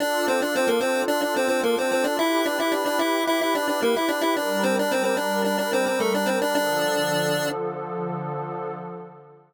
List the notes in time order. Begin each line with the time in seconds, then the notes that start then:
0.00 D4 F4 A4 D5
0.28 C4 C5
0.42 D4 D5
0.56 C4 C5
0.67 A#3 A#4
0.81 C4 C5
1.08 D4 D5
1.22 D4 D5
1.36 C4 C5
1.48 C4 C5
1.63 A#3 A#4
1.78 C4 C5
1.92 C4 C5
2.04 D4 D5
2.19 E4 G4 B4 E5
2.46 D4 D5
2.60 E4 E5
2.72 D4 D5
2.86 D4 D5
2.99 E4 E5
3.27 E4 E5
3.41 E4 E5
3.55 D4 D5
3.68 D4 D5
3.82 A#3 A#4
3.96 E4 E5
4.09 D4 D5
4.21 E4 E5
4.36 G3 D4 A#4 D5
4.63 C4 C5
4.79 D4 D5
4.91 C4 C5
5.04 C4 C5
5.17 D4 D5
5.44 D4 D5
5.58 D4 D5
5.73 C4 C5
5.86 C4 C5
6.00 A3 A4
6.14 D4 D5
6.26 C4 C5
6.42 D4 D5
6.55 D3 F3 D4 A4 D5